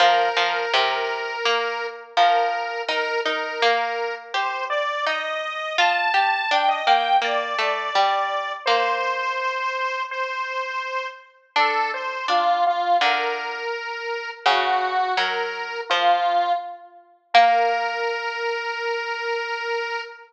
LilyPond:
<<
  \new Staff \with { instrumentName = "Lead 1 (square)" } { \time 4/4 \key bes \major \tempo 4 = 83 bes'2. bes'4 | bes'8 bes'4. c''8 d''8 ees''4 | a''4 g''16 ees''16 g''8 d''2 | c''2 c''4. r8 |
a'8 c''8 f'8 f'8 bes'2 | ges'4 bes'4 f'4 r4 | bes'1 | }
  \new Staff \with { instrumentName = "Harpsichord" } { \time 4/4 \key bes \major f8 f8 c4 bes4 f4 | ees'8 ees'8 bes4 g'4 ees'4 | f'8 g'8 d'8 bes8 bes8 a8 g4 | bes2. r4 |
d'4 d'4 d4 r4 | des4 ges4 f4 r4 | bes1 | }
>>